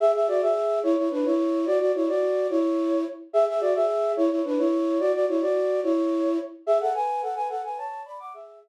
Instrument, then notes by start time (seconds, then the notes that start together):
flute
0.00 G#4 E5
0.15 G#4 E5
0.28 F#4 D5
0.42 G#4 E5
0.83 E4 C#5
0.97 E4 C#5
1.11 D4 B4
1.25 E4 C#5
1.66 F#4 D5
1.81 F#4 D5
1.95 E4 C#5
2.08 F#4 D5
2.50 E4 C#5
3.33 G#4 E5
3.48 G#4 E5
3.61 F#4 D5
3.75 G#4 E5
4.17 E4 C#5
4.30 E4 C#5
4.45 D4 B4
4.58 E4 C#5
5.00 F#4 D5
5.14 F#4 D5
5.28 E4 C#5
5.41 F#4 D5
5.83 E4 C#5
6.67 G#4 E5
6.81 A4 F#5
6.94 B4 G#5
7.22 A4 F#5
7.36 B4 G#5
7.49 A4 F#5
7.64 B4 G#5
7.77 C#5 A5
8.05 D5 B5
8.20 F#5 D6
8.34 G#4 E5